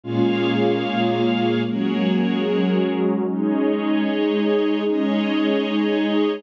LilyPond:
<<
  \new Staff \with { instrumentName = "Pad 2 (warm)" } { \time 6/8 \key aes \mixolydian \tempo 4. = 75 <bes, aes des' f'>4. <bes, aes bes f'>4. | <ges aes bes des'>4. <ges aes des' ges'>4. | <aes des' ees'>4. <aes ees' aes'>4. | <aes des' ees'>4. <aes ees' aes'>4. | }
  \new Staff \with { instrumentName = "String Ensemble 1" } { \time 6/8 \key aes \mixolydian <bes aes' des'' f''>2. | <ges' aes' bes' des''>2. | <aes' des'' ees''>2. | <aes' des'' ees''>2. | }
>>